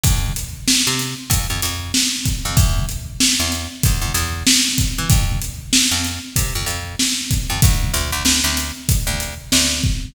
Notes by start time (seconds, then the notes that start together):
0.03 F2, kick, closed hi-hat
0.36 closed hi-hat
0.68 snare
0.87 C3
0.99 snare, closed hi-hat
1.30 F2, kick, closed hi-hat
1.50 F2
1.62 F2, closed hi-hat
1.94 snare
2.25 kick, closed hi-hat
2.45 F2
2.57 E2, kick, closed hi-hat
2.89 closed hi-hat
3.20 snare
3.40 E2
3.52 closed hi-hat
3.83 E2, kick, closed hi-hat
4.01 E2
4.14 E2, closed hi-hat
4.47 snare
4.78 kick, closed hi-hat
4.98 E3
5.10 F2, kick, closed hi-hat
5.41 closed hi-hat
5.73 snare
5.91 F2
6.04 closed hi-hat
6.36 C3, kick, closed hi-hat
6.55 F2
6.66 F2, closed hi-hat
6.99 snare
7.31 kick, closed hi-hat
7.50 F2
7.62 D2, kick, closed hi-hat
7.94 D2, closed hi-hat
8.12 D2
8.25 D2, snare
8.44 D2
8.57 closed hi-hat
8.89 kick, closed hi-hat
9.07 D2
9.20 closed hi-hat
9.52 D2, snare
9.83 kick